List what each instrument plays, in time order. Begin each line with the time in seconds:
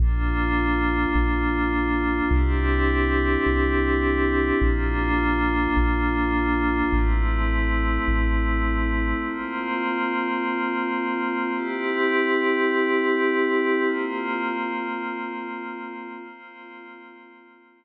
0.00 synth bass 2 A#1, pad 5 (bowed) A#3 D4 F4
1.15 synth bass 2 A#1
2.31 synth bass 2 C2, pad 5 (bowed) C4 D4 E4 G4
3.46 synth bass 2 C2
4.62 synth bass 2 A#1, pad 5 (bowed) A#3 D4 F4
5.77 synth bass 2 A#1
6.92 synth bass 2 A1, pad 5 (bowed) A3 C4 E4
8.08 synth bass 2 A1
9.24 pad 5 (bowed) A#3 C4 F4
11.54 pad 5 (bowed) C4 E4 G4
13.84 pad 5 (bowed) A#3 C4 F4
16.16 pad 5 (bowed) A#3 C4 F4